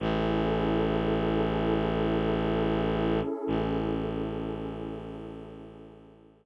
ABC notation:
X:1
M:4/4
L:1/8
Q:1/4=69
K:A
V:1 name="Pad 2 (warm)"
[CEGA]8- | [CEGA]8 |]
V:2 name="Violin" clef=bass
A,,,8 | A,,,8 |]